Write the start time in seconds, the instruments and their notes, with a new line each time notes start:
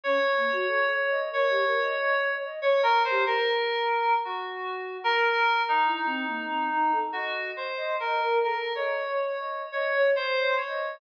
0.03 flute C#4, electric piano 2 C#5
0.36 flute A#3
0.52 flute F#4
0.67 flute A4
0.91 flute C#5
1.10 flute D#5
1.31 flute A#4, electric piano 2 C#5
1.50 flute G4
1.65 flute A#4
1.81 flute D#5
1.99 flute D#5
2.28 flute C#5
2.45 flute D#5
2.62 electric piano 2 C#5
2.83 electric piano 2 A#4
3.04 electric piano 2 C5
3.10 flute G4
3.26 electric piano 2 A#4
4.25 electric piano 2 F#4
5.04 electric piano 2 A#4
5.68 electric piano 2 D#4
5.85 flute E4
6.06 flute C4
6.26 flute A#3
6.50 flute C4
6.70 flute D#4
6.92 flute A4
7.12 electric piano 2 F#4, flute D#5
7.56 electric piano 2 C5
7.77 flute D#5
8.00 electric piano 2 A#4, flute D#5
8.20 flute A#4
8.43 flute A4, electric piano 2 A#4
8.75 electric piano 2 C#5, flute D#5
9.09 flute C#5
9.39 flute D#5
9.72 electric piano 2 C#5, flute D#5
9.95 flute C#5
10.15 flute C5, electric piano 2 C5
10.38 flute C#5
10.57 electric piano 2 C#5
10.67 flute D#5